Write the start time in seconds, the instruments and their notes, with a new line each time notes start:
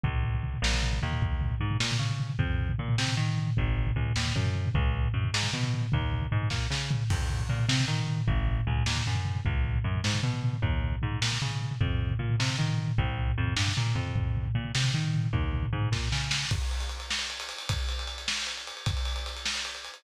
0.04 electric bass (finger) C#2, kick, floor tom
0.13 floor tom
0.23 floor tom
0.34 floor tom
0.43 floor tom
0.54 floor tom
0.62 electric bass (finger) A#1, snare
0.73 floor tom
0.83 floor tom
0.93 floor tom
1.02 electric bass (finger) D#2, floor tom
1.12 floor tom
1.22 kick, floor tom
1.32 floor tom
1.41 floor tom
1.50 floor tom
1.60 electric bass (finger) G#2, floor tom
1.71 floor tom
1.80 electric bass (finger) A#2, snare
1.91 floor tom
1.99 electric bass (finger) C#3, floor tom
2.10 floor tom
2.20 floor tom
2.30 floor tom
2.39 electric bass (finger) F2, kick, floor tom
2.50 floor tom
2.59 floor tom
2.69 floor tom
2.79 electric bass (finger) A#2, floor tom
2.88 floor tom
2.98 electric bass (finger) C3, snare
3.08 floor tom
3.17 electric bass (finger) D#3, floor tom
3.29 floor tom
3.38 floor tom
3.47 floor tom
3.57 electric bass (finger) G#1, kick, floor tom
3.67 floor tom
3.77 floor tom
3.87 floor tom
3.96 electric bass (finger) C#2, floor tom
4.06 floor tom
4.16 electric bass (finger) D#2, snare
4.26 floor tom
4.35 electric bass (finger) F#2, floor tom
4.45 floor tom
4.55 floor tom
4.66 floor tom
4.75 electric bass (finger) C#2, kick, floor tom
4.85 floor tom
4.94 floor tom
5.04 floor tom
5.14 electric bass (finger) F#2, floor tom
5.24 floor tom
5.34 electric bass (finger) G#2, snare
5.43 floor tom
5.53 electric bass (finger) B2, floor tom
5.63 floor tom
5.74 floor tom
5.82 floor tom
5.92 electric bass (finger) D#2, kick, floor tom
6.01 floor tom
6.12 floor tom
6.22 floor tom
6.32 electric bass (finger) G#2, floor tom
6.42 floor tom
6.50 electric bass (finger) A#2, kick, snare
6.71 electric bass (finger) C#3, snare
6.91 floor tom
7.10 electric bass (finger) F2, kick, crash
7.20 floor tom
7.30 floor tom
7.39 floor tom
7.49 electric bass (finger) A#2, floor tom
7.59 floor tom
7.68 electric bass (finger) C3, snare
7.80 floor tom
7.88 electric bass (finger) D#3, floor tom
7.98 floor tom
8.07 floor tom
8.17 floor tom
8.28 electric bass (finger) G#1, kick, floor tom
8.37 floor tom
8.47 floor tom
8.58 floor tom
8.67 electric bass (finger) C#2, floor tom
8.76 floor tom
8.86 electric bass (finger) D#2, snare
8.96 floor tom
9.06 electric bass (finger) F#2, floor tom
9.15 floor tom
9.25 floor tom
9.35 floor tom
9.45 electric bass (finger) C#2, kick, floor tom
9.55 floor tom
9.65 floor tom
9.74 floor tom
9.84 electric bass (finger) F#2, floor tom
9.95 floor tom
10.04 electric bass (finger) G#2, snare
10.14 floor tom
10.23 electric bass (finger) B2, floor tom
10.34 floor tom
10.43 floor tom
10.53 floor tom
10.62 electric bass (finger) D#2, kick, floor tom
10.73 floor tom
10.82 floor tom
10.92 floor tom
11.02 electric bass (finger) G#2, floor tom
11.12 floor tom
11.22 electric bass (finger) A#2, snare
11.32 floor tom
11.42 electric bass (finger) C#3, floor tom
11.51 floor tom
11.61 floor tom
11.71 floor tom
11.81 electric bass (finger) F2, kick, floor tom
11.90 floor tom
12.01 floor tom
12.10 floor tom
12.19 electric bass (finger) A#2, floor tom
12.29 floor tom
12.40 electric bass (finger) C3, snare
12.50 floor tom
12.58 electric bass (finger) D#3, floor tom
12.69 floor tom
12.78 floor tom
12.87 floor tom
12.98 electric bass (finger) C2, kick, floor tom
13.08 floor tom
13.18 floor tom
13.28 floor tom
13.38 electric bass (finger) F2, floor tom
13.47 floor tom
13.56 electric bass (finger) G2, snare
13.67 floor tom
13.77 electric bass (finger) A#2, floor tom
13.87 floor tom
13.95 electric bass (finger) F2, floor tom
14.07 floor tom
14.16 kick, floor tom
14.25 floor tom
14.37 floor tom
14.45 floor tom
14.55 electric bass (finger) A#2, floor tom
14.65 floor tom
14.75 electric bass (finger) C3, snare
14.84 floor tom
14.94 electric bass (finger) D#3, floor tom
15.05 floor tom
15.14 floor tom
15.24 floor tom
15.33 electric bass (finger) D#2, kick, floor tom
15.43 floor tom
15.53 floor tom
15.63 floor tom
15.73 electric bass (finger) G#2, floor tom
15.82 floor tom
15.92 electric bass (finger) A#2, kick, snare
16.12 electric bass (finger) C#3, snare
16.31 snare
16.51 kick, crash
16.62 ride
16.71 ride
16.80 ride
16.89 ride
17.00 ride
17.11 snare
17.19 ride
17.30 ride
17.40 ride
17.49 ride
17.58 ride
17.69 kick, ride
17.79 ride
17.89 ride
17.99 ride
18.07 ride
18.18 ride
18.28 snare
18.38 ride
18.47 ride
18.57 ride
18.67 ride
18.77 ride
18.86 kick, ride
18.97 ride
19.05 ride
19.16 ride
19.26 ride
19.37 ride
19.46 snare
19.55 ride
19.65 ride
19.75 ride
19.85 ride
19.94 ride